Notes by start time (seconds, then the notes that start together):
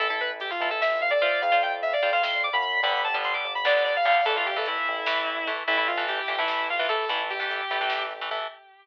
0.00 A1 E4 A4, kick, closed hi-hat
0.10 E4 A4, kick
0.20 B4, kick, closed hi-hat
0.31 kick
0.40 G4, kick, closed hi-hat
0.50 F4, kick
0.60 A1 E4 A4, kick, closed hi-hat
0.70 E4 A4, kick
0.81 E5, kick, snare
0.91 kick
1.00 F5, kick, closed hi-hat
1.10 D5, kick
1.20 F4 C5 D5, kick, closed hi-hat
1.32 kick
1.41 F2 F5, kick, closed hi-hat
1.52 F4 C5, kick
1.62 G5, kick, closed hi-hat
1.72 kick
1.82 E5, kick, closed hi-hat
1.93 D5, kick
2.02 F2 F4 C5, kick, closed hi-hat
2.13 F4 C5 F5, kick
2.22 F2 C6, kick, snare
2.33 kick
2.43 D6, kick, closed hi-hat
2.53 F#2 B5, kick
2.62 B5, kick, closed hi-hat
2.73 kick
2.83 G1 D3 G3 B3 B5, kick, closed hi-hat
2.93 kick
3.04 A5, kick, closed hi-hat
3.14 D3 G3 B3, kick
3.24 C6, kick, closed hi-hat
3.33 D6, kick
3.44 G1, kick, closed hi-hat
3.55 B5, kick
3.65 D3 G3 B3 D5, kick, snare
3.75 kick
3.84 D5, kick, closed hi-hat
3.95 F5, kick
4.05 D3 G3 B3 F5, kick, closed hi-hat
4.16 kick
4.25 A1 E3 A3 A4, kick, closed hi-hat
4.35 F4, kick
4.46 G4, kick, closed hi-hat
4.56 E3 A3 A4, kick
4.65 E4, kick, closed hi-hat
4.76 kick
4.86 A1, kick, closed hi-hat
4.96 kick
5.06 E3 A3, kick, snare
5.17 kick
5.27 kick, closed hi-hat
5.37 kick
5.47 E3 A3, kick, closed hi-hat
5.57 kick
5.67 A1 E3 A3 E4, kick, closed hi-hat
5.77 E4, kick
5.87 F4, kick, closed hi-hat
5.97 E3 A3, kick
6.07 G4, kick, closed hi-hat
6.18 G4, kick
6.28 A1 E3 A3 G4, kick, closed hi-hat
6.38 E3 A3 E4, kick
6.48 E4, kick, snare
6.59 kick
6.69 F4, kick, closed hi-hat
6.79 E3 A3 F4, kick
6.89 E3 A3 A4, kick, closed hi-hat
7.00 kick
7.09 A1 E3 A3 E4, kick, closed hi-hat
7.19 kick
7.30 G4, kick, closed hi-hat
7.40 E3 A3, kick
7.51 kick, closed hi-hat
7.61 kick
7.70 A1 E3 A3, kick, closed hi-hat
7.81 E3 A3, kick
7.90 kick, snare
8.01 kick
8.11 kick, closed hi-hat
8.21 E3 A3, kick
8.31 E3 A3, kick, closed hi-hat
8.42 kick